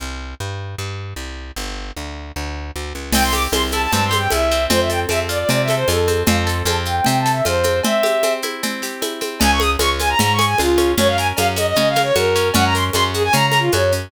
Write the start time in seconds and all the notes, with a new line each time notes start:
0.00 C2
0.40 G2
0.78 G2
1.16 C2
1.56 G1
1.96 D2
2.36 D2
2.76 D2
2.95 C#2
3.12 C2 C4 G5, crash, cowbell, low conga, shaker
3.23 C6
3.33 G4 D6, high conga, shaker
3.52 C2 C4 C6, cowbell, high conga, shaker
3.71 E4 A5, high conga, shaker
3.82 A5
3.92 G2 C4 A5, cowbell, low conga, shaker
4.05 C6
4.11 G4, snare, high conga, shaker
4.18 G5
4.30 C2 E4 E5, cowbell, high conga, shaker
4.51 C4, shaker
4.70 F2 C4 C5, cowbell, low conga, shaker
4.80 E5
4.90 A4 G5, shaker
5.09 F2 C4 E5, cowbell, high conga, shaker
5.29 F4 D5, shaker
5.39 D5
5.49 C3 C4 D5, cowbell, low conga, shaker
5.62 E5
5.68 A4, snare, high conga, shaker
5.75 C5
5.88 F2 F4 A4, cowbell, high conga, shaker
6.08 C4, high conga, shaker
6.26 F2 C4 F5, cowbell, low conga, shaker
6.37 A5
6.47 A4 C6, shaker
6.65 F2 C4 A5, cowbell, high conga, shaker
6.85 F4 G5, shaker
6.96 G5
7.04 C3 C4 G5, cowbell, low conga, shaker
7.19 A5
7.26 A4, snare, shaker
7.32 E5
7.45 F2 F4 C5, cowbell, high conga, shaker
7.63 C4, high conga, shaker
7.83 C4 E5, cowbell, low conga, shaker
8.03 G4, high conga, shaker
8.23 C4, cowbell, high conga, shaker
8.42 E4, high conga, shaker
8.63 C4, cowbell, low conga, shaker
8.82 G4, snare, shaker
9.02 E4, cowbell, high conga, shaker
9.21 C4, high conga, shaker
9.40 C#2 C#4 G#5, cowbell, low conga, shaker
9.51 C#6
9.60 G#4 D#6, high conga, shaker
9.79 C#2 C#4 C#6, cowbell, high conga, shaker
10.00 F4 G#5, high conga, shaker
10.09 A#5
10.19 G#2 C#4 A#5, cowbell, low conga, shaker
10.33 C#6
10.39 G#4, snare, high conga, shaker
10.46 G#5
10.58 C#2 F4, cowbell, high conga, shaker
10.78 C#4, high conga, shaker
10.98 F#2 C#4 C#5, cowbell, low conga, shaker
11.08 F5
11.18 A#4 G#5, shaker
11.37 F#2 C#4 F5, cowbell, high conga, shaker
11.56 F#4 D#5, high conga, shaker
11.67 D#5
11.76 C#3 C#4 D#5, cowbell, low conga, shaker
11.89 F5
11.96 A#4, snare, high conga, shaker
12.03 C#5
12.15 F#2 F#4 A#4, cowbell, high conga, shaker
12.36 C#4, shaker
12.54 F#2 C#4 F#5, cowbell, low conga, shaker
12.65 A#5
12.75 A#4 C6, shaker
12.93 F#2 C#4 C6, cowbell, high conga, shaker
13.13 F#4 G#4, shaker
13.24 G#5
13.33 C#3 C#4 A#5, cowbell, low conga, shaker
13.46 A#5
13.52 A#4, snare, high conga, shaker
13.59 F4
13.72 F#2 F#4 C#5, cowbell, high conga, shaker
13.92 C#4, shaker